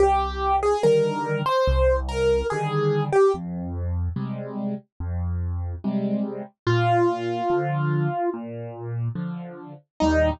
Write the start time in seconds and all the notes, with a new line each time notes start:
0.00 C2 G4
0.63 G#4
0.83 D3 D#3 G3 A#4
1.46 C5
1.68 C2
2.09 A#4
2.50 D3 D#3 G3 G#4
3.12 G4
3.34 F2
4.16 C3 G3 G#3
5.00 F2
5.84 C3 G3 G#3
6.67 A#2 F4
7.50 D3 F3
8.34 A#2
9.15 D3 F3
10.00 D#2 A#2 G3 D#4